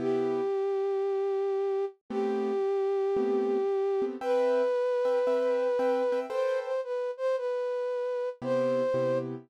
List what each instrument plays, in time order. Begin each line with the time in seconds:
0.00 acoustic grand piano C3 B3 E4 G4, flute G4
2.10 acoustic grand piano A3 B3 C4 G4, flute G4
3.17 acoustic grand piano A3 B3 C4 G4
4.02 acoustic grand piano A3 B3 C4 G4
4.21 acoustic grand piano C4 B4 E5 G5, flute B4
5.05 acoustic grand piano C4 B4 E5 G5
5.27 acoustic grand piano C4 B4 E5 G5
5.79 acoustic grand piano C4 B4 E5 G5
6.12 acoustic grand piano C4 B4 E5 G5
6.30 acoustic grand piano A4 B4 C5 G5, flute C5
6.64 flute C5
6.84 flute B4
7.17 flute C5
7.37 flute B4
8.42 acoustic grand piano C3 B3 E4 G4, flute C5
8.94 acoustic grand piano C3 B3 E4 G4